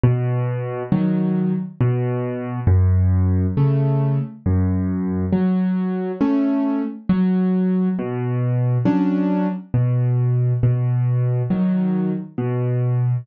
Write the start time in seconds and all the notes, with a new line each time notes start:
0.03 B2
0.92 D#3 F#3
1.81 B2
2.67 F#2
3.57 C#3 A3
4.46 F#2
5.33 F#3
6.21 A3 C#4
7.09 F#3
7.99 B2
8.85 F#3 C#4 D4
9.74 B2
10.63 B2
11.50 D#3 F#3
12.38 B2